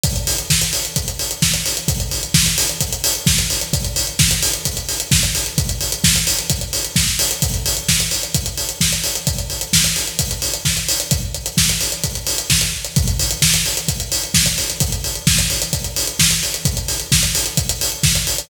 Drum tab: HH |xxox-xoxxxox-xox|xxox-xoxxxox-xox|xxox-xoxxxox-xox|xxox-xoxxxox--ox|
SD |----o-------o---|----o-------o---|----o-------o---|----o-------oo--|
BD |o---o---o---o---|o---o---o---o---|o---o---o---o---|o---o---o---o---|

HH |xxox-xoxxxox-xox|xxox-xoxxxox-xox|x-xx-xoxxxox-x-x|xxox-xoxxxox-xox|
SD |----o-------o---|----o-------o---|----o-------o---|----o-------o---|
BD |o---o---o---o---|o---o---o---o---|o---o---o---o---|o---o---o---oo--|

HH |xxox-xoxxxox-xox|xxox-xoxxxox-xox|
SD |----o-------o---|----o-------o---|
BD |o---o---o---o---|o---o---o---o---|